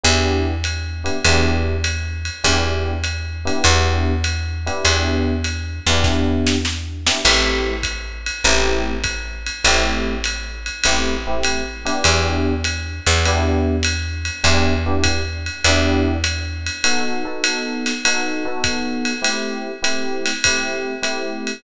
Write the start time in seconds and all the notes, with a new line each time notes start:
0.04 E2 B3 D4 E4 G4, ride
0.64 hi-hat pedal, ride
1.04 B3 D4 E4 G4, ride
1.24 E2 B3 D4 E4 G4, ride
1.84 hi-hat pedal, ride
2.25 ride
2.44 E2 B3 D4 E4 G4, kick, ride
3.04 hi-hat pedal, ride
3.45 B3 D4 E4 G4, ride
3.64 E2, ride
4.24 hi-hat pedal, ride
4.66 B3 D4 E4 G4, ride
4.84 E2, ride
5.44 hi-hat pedal, ride
5.87 E2 B3 D4 E4 G4, ride
6.04 kick, snare
6.46 snare
6.65 snare
7.06 B3 D4 E4 G4, snare
7.25 A1 A3 C4 E4 G4, crash, ride
7.83 kick, hi-hat pedal, ride
8.26 ride
8.44 A1 A3 C4 E4 G4, ride
9.04 kick, hi-hat pedal, ride
9.46 ride
9.64 A1 A3 C4 E4 G4, ride
10.24 hi-hat pedal, ride
10.66 ride
10.84 A1 A3 C4 E4 G4, ride
11.27 A3 C4 E4 G4
11.43 hi-hat pedal, ride
11.85 B3 D4 E4 G4, ride
12.04 E2, ride
12.64 hi-hat pedal, ride
13.06 E2, ride
13.25 B3 D4 E4 G4, ride
13.83 hi-hat pedal, ride
14.25 ride
14.44 E2 B3 D4 E4 G4, ride
14.86 B3 D4 E4 G4
15.04 kick, hi-hat pedal, ride
15.46 ride
15.64 E2 B3 D4 E4 G4, ride
16.24 hi-hat pedal, ride
16.66 ride
16.84 B3 D#4 F#4 A4, ride
17.25 B3 D#4 F#4 A4
17.44 hi-hat pedal, ride
17.86 snare, ride
18.05 B3 D#4 F#4 A4, ride
18.45 B3 D#4 F#4 A4
18.64 kick, hi-hat pedal, ride
19.05 ride
19.22 A3 C4 E4 G4, ride
19.82 A3 C4 E4 G4, hi-hat pedal, ride
20.25 snare, ride
20.44 A3 C4 E4 G4, kick, ride
21.03 A3 C4 E4 G4, hi-hat pedal, ride
21.47 ride